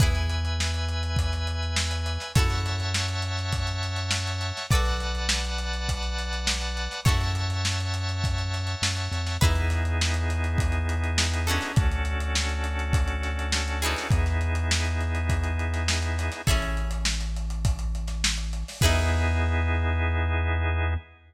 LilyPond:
<<
  \new Staff \with { instrumentName = "Acoustic Guitar (steel)" } { \time 4/4 \key e \mixolydian \tempo 4 = 102 <e' gis' b'>1 | <e' fis' a' cis''>1 | <fis' a' b' d''>1 | <e' fis' a' cis''>1 |
<dis' e' gis' b'>2.~ <dis' e' gis' b'>8 <cis' d' fis' a'>8~ | <cis' d' fis' a'>2.~ <cis' d' fis' a'>8 <b dis' e' gis'>8~ | <b dis' e' gis'>1 | <cis' e' gis' a'>1 |
<dis' e' gis' b'>1 | }
  \new Staff \with { instrumentName = "Drawbar Organ" } { \time 4/4 \key e \mixolydian <b' e'' gis''>1 | <cis'' e'' fis'' a''>1 | <b' d'' fis'' a''>1 | <cis'' e'' fis'' a''>1 |
<b dis' e' gis'>1 | <cis' d' fis' a'>1 | <b dis' e' gis'>1 | r1 |
<b dis' e' gis'>1 | }
  \new Staff \with { instrumentName = "Synth Bass 1" } { \clef bass \time 4/4 \key e \mixolydian e,1 | fis,1 | b,,1 | fis,2. fis,8 f,8 |
e,1 | d,1 | e,1 | a,,1 |
e,1 | }
  \new DrumStaff \with { instrumentName = "Drums" } \drummode { \time 4/4 <hh bd>16 hh16 hh16 hh16 sn16 hh16 hh16 hh16 <hh bd>16 <hh sn>16 hh16 hh16 sn16 hh16 <hh sn>16 <hh sn>16 | <hh bd>16 <hh sn>16 hh16 <hh sn>16 sn16 hh16 hh16 <hh sn>16 <hh bd>16 hh16 hh16 hh16 sn16 hh16 hh16 <hh sn>16 | <hh bd>16 hh16 <hh sn>16 hh16 sn16 hh16 hh16 hh16 <hh bd>16 hh16 hh16 hh16 sn16 hh16 hh16 <hh sn>16 | <hh bd>16 hh16 hh16 hh16 sn16 hh16 hh16 hh16 <hh bd>16 hh16 <hh sn>16 hh16 sn16 hh16 hh16 <hh sn>16 |
<hh bd>16 hh16 <hh sn>16 hh16 sn16 hh16 hh16 hh16 <hh bd>16 hh16 hh16 hh16 sn16 hh16 hh16 <hh sn>16 | <hh bd>16 hh16 hh16 hh16 sn16 hh16 hh16 hh16 <hh bd>16 hh16 <hh sn>16 hh16 sn16 hh16 hh16 <hh sn>16 | <hh bd>16 <hh sn>16 hh16 hh16 sn16 hh16 hh16 hh16 <hh bd>16 hh16 hh16 <hh sn>16 sn16 hh16 <hh sn>16 <hh sn>16 | <hh bd>16 hh16 hh16 hh16 sn16 <hh sn>16 hh16 hh16 <hh bd>16 hh16 hh16 <hh sn>16 sn16 hh16 hh16 <hho sn>16 |
<cymc bd>4 r4 r4 r4 | }
>>